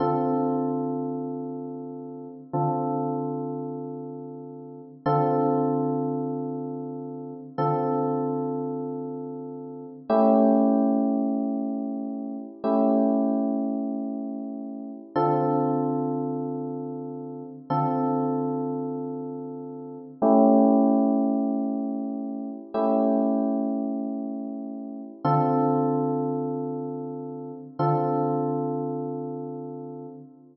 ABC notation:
X:1
M:4/4
L:1/8
Q:1/4=95
K:Dm
V:1 name="Electric Piano 1"
[D,CFA]8 | [D,CFA]8 | [D,CFA]8 | [D,CFA]8 |
[A,^CEG]8 | [A,^CEG]8 | [D,CFA]8 | [D,CFA]8 |
[A,^CEG]8 | [A,^CEG]8 | [D,CFA]8 | [D,CFA]8 |]